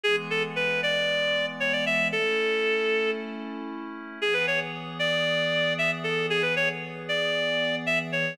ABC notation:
X:1
M:4/4
L:1/16
Q:1/4=115
K:Emix
V:1 name="Clarinet"
G z A z B2 d6 c d e2 | A8 z8 | G B c z3 d6 e z A2 | G B c z3 d6 e z c2 |]
V:2 name="Pad 5 (bowed)"
[E,G,B,]16 | [A,CE]16 | [E,B,G]16- | [E,B,G]16 |]